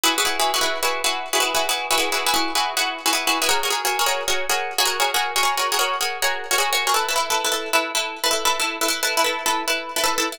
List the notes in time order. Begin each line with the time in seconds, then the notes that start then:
0.03 E4 F#4 G#4 B4
0.18 E4 F#4 G#4 B4
0.25 E4 F#4 G#4 B4
0.40 E4 F#4 G#4 B4
0.54 E4 F#4 G#4 B4
0.61 E4 F#4 G#4 B4
0.83 E4 F#4 G#4 B4
1.04 E4 F#4 G#4 B4
1.33 E4 F#4 G#4 B4
1.40 E4 F#4 G#4 B4
1.55 E4 F#4 G#4 B4
1.69 E4 F#4 G#4 B4
1.91 E4 F#4 G#4 B4
1.98 E4 F#4 G#4 B4
2.12 E4 F#4 G#4 B4
2.26 E4 F#4 G#4 B4
2.34 E4 F#4 G#4 B4
2.55 E4 F#4 G#4 B4
2.77 E4 F#4 G#4 B4
3.06 E4 F#4 G#4 B4
3.13 E4 F#4 G#4 B4
3.27 E4 F#4 G#4 B4
3.42 E4 F#4 G#4 B4
3.49 F#4 G#4 A#4 C#5
3.63 F#4 G#4 A#4 C#5
3.70 F#4 G#4 A#4 C#5
3.85 F#4 G#4 A#4 C#5
3.99 F#4 G#4 A#4 C#5
4.06 F#4 G#4 A#4 C#5
4.28 F#4 G#4 A#4 C#5
4.49 F#4 G#4 A#4 C#5
4.78 F#4 G#4 A#4 C#5
4.85 F#4 G#4 A#4 C#5
5.00 F#4 G#4 A#4 C#5
5.14 F#4 G#4 A#4 C#5
5.36 F#4 G#4 A#4 C#5
5.43 F#4 G#4 A#4 C#5
5.57 F#4 G#4 A#4 C#5
5.72 F#4 G#4 A#4 C#5
5.79 F#4 G#4 A#4 C#5
6.01 F#4 G#4 A#4 C#5
6.22 F#4 G#4 A#4 C#5
6.51 F#4 G#4 A#4 C#5
6.58 F#4 G#4 A#4 C#5
6.73 F#4 G#4 A#4 C#5
6.87 F#4 G#4 A#4 C#5
6.94 E4 A4 B4
7.09 E4 A4 B4
7.16 E4 A4 B4
7.30 E4 A4 B4
7.44 E4 A4 B4
7.52 E4 A4 B4
7.73 E4 A4 B4
7.95 E4 A4 B4
8.24 E4 A4 B4
8.31 E4 A4 B4
8.45 E4 A4 B4
8.60 E4 A4 B4
8.81 E4 A4 B4
8.88 E4 A4 B4
9.03 E4 A4 B4
9.17 E4 A4 B4
9.24 E4 A4 B4
9.46 E4 A4 B4
9.68 E4 A4 B4
9.96 E4 A4 B4
10.04 E4 A4 B4
10.18 E4 A4 B4
10.32 E4 A4 B4